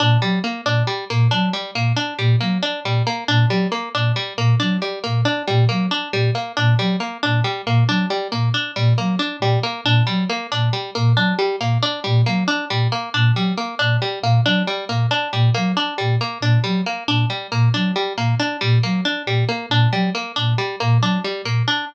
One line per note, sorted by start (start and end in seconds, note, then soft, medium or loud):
0.00 0.17 A#2 medium
0.00 0.18 D4 medium
0.22 0.39 F#3 medium
0.22 0.39 G3 medium
0.44 0.61 A#3 medium
0.65 0.83 A#2 medium
0.65 0.83 D4 medium
0.87 1.05 G3 medium
1.10 1.28 A#2 medium
1.10 1.28 A#3 medium
1.31 1.50 F#3 medium
1.31 1.49 D4 medium
1.53 1.71 G3 medium
1.75 1.92 A#2 medium
1.75 1.93 A#3 medium
1.96 2.14 D4 medium
2.18 2.36 A#2 medium
2.18 2.36 G3 medium
2.41 2.58 F#3 medium
2.41 2.58 A#3 medium
2.63 2.80 D4 medium
2.84 3.02 A#2 medium
2.84 3.03 G3 medium
3.07 3.24 A#3 medium
3.28 3.46 A#2 medium
3.28 3.46 D4 medium
3.49 3.66 F#3 medium
3.49 3.68 G3 medium
3.72 3.89 A#3 medium
3.94 4.12 A#2 medium
3.94 4.12 D4 medium
4.16 4.33 G3 medium
4.37 4.55 A#2 medium
4.37 4.55 A#3 medium
4.60 4.78 F#3 medium
4.60 4.77 D4 medium
4.82 4.99 G3 medium
5.04 5.23 A#2 medium
5.04 5.21 A#3 medium
5.25 5.43 D4 medium
5.47 5.66 A#2 medium
5.47 5.65 G3 medium
5.69 5.87 F#3 medium
5.69 5.86 A#3 medium
5.91 6.09 D4 medium
6.13 6.30 A#2 medium
6.13 6.31 G3 medium
6.35 6.52 A#3 medium
6.57 6.75 A#2 medium
6.57 6.74 D4 medium
6.78 6.96 F#3 medium
6.78 6.96 G3 medium
7.00 7.18 A#3 medium
7.23 7.42 A#2 medium
7.23 7.40 D4 medium
7.44 7.62 G3 medium
7.66 7.84 A#2 medium
7.66 7.84 A#3 medium
7.88 8.05 F#3 medium
7.88 8.06 D4 medium
8.10 8.28 G3 medium
8.32 8.50 A#2 medium
8.32 8.49 A#3 medium
8.54 8.72 D4 medium
8.76 8.94 A#2 medium
8.76 8.94 G3 medium
8.98 9.16 F#3 medium
8.98 9.15 A#3 medium
9.19 9.37 D4 medium
9.40 9.57 A#2 medium
9.40 9.59 G3 medium
9.63 9.81 A#3 medium
9.84 10.02 A#2 medium
9.84 10.03 D4 medium
10.07 10.25 F#3 medium
10.07 10.24 G3 medium
10.29 10.47 A#3 medium
10.52 10.70 A#2 medium
10.52 10.69 D4 medium
10.73 10.91 G3 medium
10.95 11.14 A#2 medium
10.95 11.13 A#3 medium
11.16 11.33 F#3 medium
11.16 11.34 D4 medium
11.39 11.56 G3 medium
11.60 11.78 A#2 medium
11.60 11.78 A#3 medium
11.83 12.00 D4 medium
12.04 12.23 A#2 medium
12.04 12.22 G3 medium
12.26 12.44 F#3 medium
12.26 12.44 A#3 medium
12.48 12.65 D4 medium
12.70 12.87 A#2 medium
12.70 12.88 G3 medium
12.92 13.09 A#3 medium
13.14 13.32 A#2 medium
13.14 13.32 D4 medium
13.35 13.52 F#3 medium
13.35 13.54 G3 medium
13.57 13.75 A#3 medium
13.79 13.97 A#2 medium
13.79 13.97 D4 medium
14.02 14.19 G3 medium
14.23 14.40 A#2 medium
14.23 14.41 A#3 medium
14.45 14.62 F#3 medium
14.45 14.63 D4 medium
14.67 14.85 G3 medium
14.89 15.06 A#2 medium
14.89 15.07 A#3 medium
15.11 15.28 D4 medium
15.33 15.50 A#2 medium
15.33 15.50 G3 medium
15.54 15.73 F#3 medium
15.54 15.72 A#3 medium
15.77 15.94 D4 medium
15.98 16.17 A#2 medium
15.98 16.16 G3 medium
16.21 16.38 A#3 medium
16.41 16.58 A#2 medium
16.41 16.60 D4 medium
16.64 16.82 F#3 medium
16.64 16.81 G3 medium
16.86 17.04 A#3 medium
17.08 17.25 A#2 medium
17.08 17.26 D4 medium
17.30 17.47 G3 medium
17.52 17.69 A#2 medium
17.52 17.69 A#3 medium
17.74 17.92 F#3 medium
17.74 17.92 D4 medium
17.96 18.13 G3 medium
18.17 18.34 A#2 medium
18.17 18.35 A#3 medium
18.40 18.57 D4 medium
18.61 18.79 A#2 medium
18.61 18.78 G3 medium
18.83 19.01 F#3 medium
18.83 19.01 A#3 medium
19.05 19.23 D4 medium
19.26 19.44 A#2 medium
19.26 19.45 G3 medium
19.49 19.66 A#3 medium
19.70 19.87 A#2 medium
19.70 19.89 D4 medium
19.92 20.09 F#3 medium
19.92 20.10 G3 medium
20.15 20.32 A#3 medium
20.36 20.55 A#2 medium
20.36 20.54 D4 medium
20.58 20.76 G3 medium
20.80 20.99 A#2 medium
20.80 20.98 A#3 medium
21.00 21.18 F#3 medium
21.00 21.20 D4 medium
21.24 21.42 G3 medium
21.44 21.62 A#2 medium
21.44 21.63 A#3 medium
21.68 21.85 D4 medium